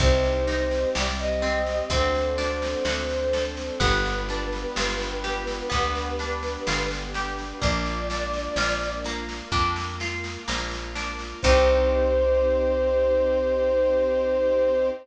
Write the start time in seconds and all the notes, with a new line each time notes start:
0.00 C2 C4 D#4 G4 C5, kick, snare
0.24 snare
0.47 D#4, snare
0.71 snare
0.95 C2 G3 C4 G4 D5, snare
1.19 D#5, snare
1.42 C4, snare
1.66 snare
1.90 D2 C4 D4 F#4 A4 C5, kick, snare
2.15 snare
2.38 D4, snare
2.62 snare
2.85 D2 C4 D4 F#4 A4 C5, snare
3.09 snare
3.33 A4, snare
3.57 snare
3.80 G1 B3 D4 F4 G4 B4, kick, snare
4.05 snare
4.29 D4, snare
4.52 snare
4.76 G1 F4, snare
5.00 snare
5.24 G4, snare
5.47 snare
5.70 D2 B3 D4 G4 B4, kick, snare
5.95 snare
6.19 D4, snare
6.43 snare
6.67 G1 F4, snare
6.91 snare
7.14 G4, snare
7.38 snare
7.61 A#1 A#3 D4 F4 D5, kick, snare
7.86 snare
8.10 D4, snare
8.34 snare
8.56 A#1 F4, snare
8.81 snare
9.04 A#3, snare
9.29 snare
9.52 F2 A#3 D4 F4 A#4, kick, snare
9.76 snare
10.00 F4, snare
10.24 snare
10.48 A#1 A#3, snare
10.71 snare
10.95 D4, snare
11.19 snare
11.42 C2 C4 D#4 G4 C5, kick, crash